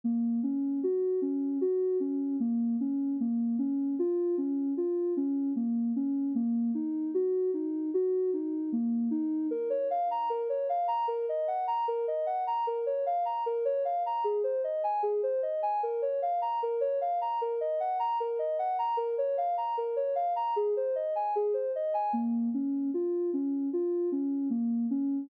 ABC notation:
X:1
M:4/4
L:1/16
Q:1/4=76
K:Bbm
V:1 name="Ocarina"
B,2 D2 G2 D2 G2 D2 B,2 D2 | B,2 D2 F2 D2 F2 D2 B,2 D2 | B,2 E2 G2 E2 G2 E2 B,2 E2 | B d f b B d f b B e g b B e g b |
B d f b B d f b A c e a A c e a | B d f b B d f b B e g b B e g b | B d f b B d f b A c e a A c e a | B,2 D2 F2 D2 F2 D2 B,2 D2 |]